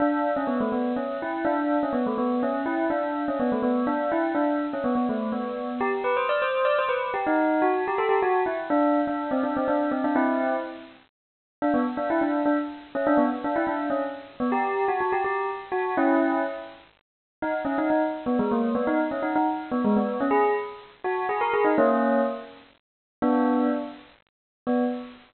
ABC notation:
X:1
M:3/4
L:1/16
Q:1/4=124
K:Bm
V:1 name="Tubular Bells"
D3 C B, A, B,2 C2 E2 | D3 C B, A, B,2 C2 E2 | D3 C B, A, B,2 D2 E2 | D3 C B, B, A,2 B,4 |
[K:Em] G z B c d c2 d c B2 G | ^D3 F2 G A G F2 E z | D3 D2 C D C D2 C D | [CE]4 z8 |
[K:Bm] D B, z D E D2 D z3 C | D B, z D E D2 C z3 B, | G3 F F G G2 z2 F2 | [CE]4 z8 |
[K:B] D z C D D z2 B, G, A,2 B, | D z C D D z2 B, G, B,2 C | G2 z4 F2 G A G D | [A,C]4 z8 |
[K:Bm] [B,D]4 z8 | B,4 z8 |]